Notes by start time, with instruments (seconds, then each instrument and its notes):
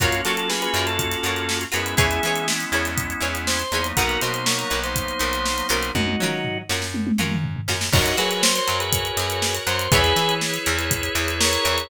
0.00 electric bass (finger) F#2, drawbar organ A#3 C#4 F4 F#4, pizzicato strings F4 F#4 A#4 C#5, kick, closed hi-hat
0.12 closed hi-hat
0.25 electric bass (finger) F#3, pizzicato strings F4 F#4 A#4 C#5, drawbar organ A4, snare, closed hi-hat
0.37 drawbar organ A4, closed hi-hat
0.49 drawbar organ G#4 B4, snare
0.62 drawbar organ G#4 B4, closed hi-hat
0.74 electric bass (finger) F#2, pizzicato strings F4 F#4 A#4, closed hi-hat
0.78 pizzicato strings C#5
0.87 drawbar organ A4, closed hi-hat
0.99 kick, closed hi-hat
1.11 snare, closed hi-hat
1.23 electric bass (finger) F#2, pizzicato strings F4 F#4 A#4 C#5, closed hi-hat
1.36 closed hi-hat
1.49 snare
1.61 closed hi-hat
1.72 electric bass (finger) F#2, drawbar organ G#3 B3 C#4 E4 G#4 B4, pizzicato strings F4 F#4 A#4 C#5, closed hi-hat
1.86 closed hi-hat
1.97 electric bass (finger) E2, pizzicato strings E4 G#4 B4 C#5, drawbar organ E4 G#4, kick, closed hi-hat
2.11 closed hi-hat
2.23 electric bass (finger) E3, pizzicato strings E4 G#4 B4, snare, closed hi-hat
2.27 pizzicato strings C#5
2.36 closed hi-hat
2.48 snare
2.60 snare, closed hi-hat
2.72 electric bass (finger) E2, pizzicato strings E4 G#4 B4 C#5, snare, closed hi-hat
2.85 snare, closed hi-hat
2.98 kick, closed hi-hat
3.10 closed hi-hat
3.20 electric bass (finger) E2, pizzicato strings E4 G#4 B4 C#5, closed hi-hat
3.35 closed hi-hat
3.47 drawbar organ C5, snare
3.59 closed hi-hat
3.72 electric bass (finger) E2, drawbar organ F#3 A#3 B3 D#4, pizzicato strings E4 G#4 B4 C#5, closed hi-hat
3.84 closed hi-hat
3.97 electric bass (finger) B1, pizzicato strings D#4 F#4 A#4 B4, drawbar organ F#4 A#4, kick, closed hi-hat
4.09 closed hi-hat
4.21 electric bass (finger) B2, pizzicato strings D#4 F#4 A#4 B4, drawbar organ C5, snare, closed hi-hat
4.34 drawbar organ C5, closed hi-hat
4.46 drawbar organ A#4 C#5, snare
4.58 drawbar organ A#4 C#5, closed hi-hat
4.70 electric bass (finger) B1, pizzicato strings D#4 F#4 A#4 B4, closed hi-hat
4.84 drawbar organ C5, snare, closed hi-hat
4.96 kick, closed hi-hat
5.08 closed hi-hat
5.19 electric bass (finger) B1, pizzicato strings D#4 F#4 A#4 B4, closed hi-hat
5.33 closed hi-hat
5.46 snare
5.58 closed hi-hat
5.69 electric bass (finger) B1, pizzicato strings C#4 F4 F#4 A#4, drawbar organ C5, closed hi-hat
5.83 closed hi-hat
5.95 electric bass (finger) F#2, drawbar organ D#4 F#4, kick, high tom
6.08 high tom
6.20 electric bass (finger) F#3, pizzicato strings C#4 F4 F#4, mid tom
6.24 pizzicato strings A#4
6.45 floor tom
6.69 electric bass (finger) F#2, pizzicato strings C#4 F4 F#4 A#4, snare
6.82 snare
6.94 high tom
7.07 high tom
7.18 electric bass (finger) F#2, pizzicato strings C#4 F4 F#4 A#4, mid tom
7.31 mid tom
7.44 floor tom
7.56 floor tom
7.68 electric bass (finger) F#2, pizzicato strings C#4 F4 F#4 A#4, snare
7.81 snare
7.93 electric bass (finger) F#2, drawbar organ D#4 F#4 A#4 C#5, pizzicato strings C#5 F#5 A#5, kick, crash
8.06 closed hi-hat
8.17 electric bass (finger) F#3, pizzicato strings F#4, drawbar organ G#4 B4, snare, closed hi-hat
8.31 drawbar organ G#4 B4, closed hi-hat
8.43 drawbar organ C5, snare
8.55 drawbar organ C5, snare, closed hi-hat
8.67 electric bass (finger) F#2, pizzicato strings F#3, closed hi-hat
8.80 drawbar organ G#4 B4, closed hi-hat
8.93 kick, closed hi-hat
9.05 closed hi-hat
9.17 electric bass (finger) F#2, pizzicato strings F#3, snare, closed hi-hat
9.30 closed hi-hat
9.42 snare
9.55 closed hi-hat
9.67 electric bass (finger) F#2, pizzicato strings F#3, drawbar organ C5, closed hi-hat
9.79 closed hi-hat
9.92 electric bass (finger) E2, drawbar organ E4 G#4 B4 C#5, pizzicato strings C#5 E5 G#5 B5, kick, closed hi-hat
10.04 snare, closed hi-hat
10.16 electric bass (finger) E3, pizzicato strings E4, snare, closed hi-hat
10.29 closed hi-hat
10.41 snare
10.54 closed hi-hat
10.66 electric bass (finger) E2, pizzicato strings E3, closed hi-hat
10.79 closed hi-hat
10.91 kick, closed hi-hat
11.03 closed hi-hat
11.15 electric bass (finger) E2, pizzicato strings E3, closed hi-hat
11.28 closed hi-hat
11.40 drawbar organ A#4 C#5, snare
11.53 closed hi-hat
11.65 electric bass (finger) E2, pizzicato strings E3, closed hi-hat
11.78 closed hi-hat